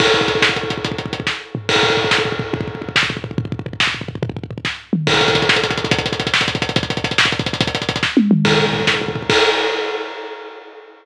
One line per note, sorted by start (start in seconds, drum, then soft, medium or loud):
0.00 kick loud
0.00 crash loud
0.07 kick medium
0.14 kick medium
0.14 closed hi-hat medium
0.21 kick medium
0.28 kick medium
0.28 closed hi-hat medium
0.35 kick medium
0.42 kick medium
0.42 snare loud
0.49 kick medium
0.56 kick medium
0.56 closed hi-hat medium
0.63 kick medium
0.70 kick medium
0.70 closed hi-hat medium
0.78 kick medium
0.85 kick medium
0.85 closed hi-hat medium
0.92 kick medium
0.98 kick medium
0.98 closed hi-hat medium
1.06 kick medium
1.13 kick medium
1.13 closed hi-hat medium
1.20 kick medium
1.27 kick medium
1.27 snare medium
1.55 floor tom loud
1.69 kick medium
1.69 crash loud
1.76 kick medium
1.83 kick medium
1.83 floor tom medium
1.90 kick medium
1.97 kick medium
1.97 floor tom medium
2.04 kick medium
2.11 kick medium
2.11 snare loud
2.18 kick medium
2.25 kick medium
2.25 floor tom medium
2.32 kick medium
2.39 kick medium
2.39 floor tom medium
2.53 kick loud
2.53 floor tom loud
2.61 kick medium
2.68 kick medium
2.68 floor tom medium
2.75 kick medium
2.82 kick medium
2.82 floor tom medium
2.89 kick medium
2.96 kick medium
2.96 snare loud
3.03 kick medium
3.10 kick medium
3.10 floor tom medium
3.17 kick medium
3.24 kick medium
3.24 floor tom medium
3.31 kick medium
3.38 kick medium
3.38 floor tom loud
3.45 kick medium
3.52 kick medium
3.52 floor tom medium
3.59 kick medium
3.66 kick medium
3.66 floor tom medium
3.73 kick medium
3.80 kick medium
3.80 snare loud
3.87 kick medium
3.94 floor tom medium
4.01 kick medium
4.08 kick medium
4.08 floor tom medium
4.15 kick medium
4.23 kick loud
4.23 floor tom loud
4.30 kick medium
4.37 kick medium
4.37 floor tom medium
4.44 kick medium
4.51 kick medium
4.51 floor tom medium
4.58 kick medium
4.65 kick medium
4.65 snare medium
4.93 mid tom medium
5.07 kick loud
5.07 crash loud
5.14 kick medium
5.14 closed hi-hat medium
5.21 kick medium
5.21 closed hi-hat medium
5.28 kick loud
5.28 closed hi-hat medium
5.35 kick medium
5.35 closed hi-hat medium
5.42 kick medium
5.42 closed hi-hat medium
5.49 kick medium
5.49 snare loud
5.56 kick medium
5.56 closed hi-hat medium
5.64 kick medium
5.64 closed hi-hat medium
5.70 kick medium
5.70 closed hi-hat medium
5.78 kick medium
5.78 closed hi-hat medium
5.84 kick medium
5.84 closed hi-hat medium
5.91 kick loud
5.91 closed hi-hat loud
5.99 kick medium
5.99 closed hi-hat medium
6.06 kick medium
6.06 closed hi-hat medium
6.12 kick medium
6.12 closed hi-hat medium
6.20 kick medium
6.20 closed hi-hat medium
6.27 kick medium
6.27 closed hi-hat medium
6.34 kick medium
6.34 snare loud
6.41 kick medium
6.41 closed hi-hat medium
6.48 kick medium
6.48 closed hi-hat medium
6.55 kick medium
6.55 closed hi-hat medium
6.62 kick medium
6.62 closed hi-hat medium
6.69 kick medium
6.69 closed hi-hat medium
6.76 kick loud
6.76 closed hi-hat loud
6.83 kick medium
6.83 closed hi-hat medium
6.90 kick medium
6.90 closed hi-hat medium
6.97 kick medium
6.97 closed hi-hat medium
7.04 kick medium
7.04 closed hi-hat medium
7.11 kick medium
7.11 closed hi-hat medium
7.18 kick medium
7.18 snare loud
7.25 kick medium
7.25 closed hi-hat medium
7.32 kick medium
7.32 closed hi-hat medium
7.39 kick loud
7.39 closed hi-hat medium
7.46 kick medium
7.46 closed hi-hat medium
7.53 kick medium
7.53 closed hi-hat medium
7.61 kick loud
7.61 closed hi-hat loud
7.67 kick medium
7.67 closed hi-hat medium
7.75 kick medium
7.75 closed hi-hat medium
7.82 kick medium
7.82 closed hi-hat medium
7.89 kick medium
7.89 closed hi-hat medium
7.96 kick medium
7.96 closed hi-hat medium
8.03 kick medium
8.03 snare medium
8.17 high tom medium
8.31 mid tom loud
8.45 kick loud
8.45 crash medium
8.52 kick medium
8.59 kick medium
8.59 floor tom medium
8.66 kick medium
8.73 kick medium
8.73 floor tom medium
8.80 kick medium
8.87 kick medium
8.87 snare medium
8.94 kick medium
9.01 kick medium
9.01 floor tom medium
9.08 kick medium
9.15 kick medium
9.15 floor tom medium
9.22 kick medium
9.30 kick loud
9.30 crash loud